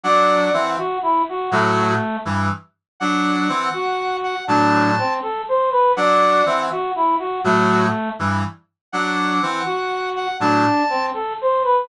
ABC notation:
X:1
M:6/8
L:1/8
Q:3/8=81
K:Dmix
V:1 name="Brass Section"
f3 z3 | F2 z4 | f5 f | a3 z3 |
f3 z3 | F2 z4 | f5 f | a3 z3 |]
V:2 name="Brass Section"
d2 e F E F | A,3 z3 | z3 F3 | D2 C A c B |
d2 e F E F | A,3 z3 | z3 F3 | D2 C A c B |]
V:3 name="Brass Section"
[F,D]2 [E,C] z3 | [A,,F,]2 z [G,,E,] z2 | [F,D]2 [E,C] z3 | [A,,F,]2 z4 |
[F,D]2 [E,C] z3 | [A,,F,]2 z [G,,E,] z2 | [F,D]2 [E,C] z3 | [A,,F,] z5 |]